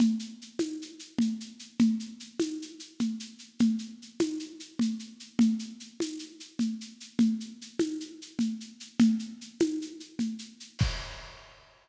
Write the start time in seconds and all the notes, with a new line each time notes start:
0.00 low conga, shaker
0.19 shaker
0.42 shaker
0.59 tambourine, high conga, shaker
0.82 shaker
0.99 shaker
1.19 low conga, shaker
1.40 shaker
1.59 shaker
1.79 low conga, shaker
2.00 shaker
2.20 shaker
2.40 tambourine, high conga, shaker
2.62 shaker
2.80 shaker
3.00 low conga, shaker
3.20 shaker
3.39 shaker
3.59 low conga, shaker
3.79 shaker
4.02 shaker
4.20 tambourine, high conga, shaker
4.40 shaker
4.60 shaker
4.79 low conga, shaker
4.99 shaker
5.20 shaker
5.39 low conga, shaker
5.59 shaker
5.80 shaker
6.00 tambourine, high conga, shaker
6.19 shaker
6.40 shaker
6.59 low conga, shaker
6.81 shaker
7.00 shaker
7.19 low conga, shaker
7.40 shaker
7.61 shaker
7.79 tambourine, high conga, shaker
8.00 shaker
8.22 shaker
8.39 low conga, shaker
8.60 shaker
8.80 shaker
8.99 low conga, shaker
9.19 shaker
9.41 shaker
9.60 tambourine, high conga, shaker
9.82 shaker
10.00 shaker
10.19 low conga, shaker
10.39 shaker
10.60 shaker
10.79 kick, crash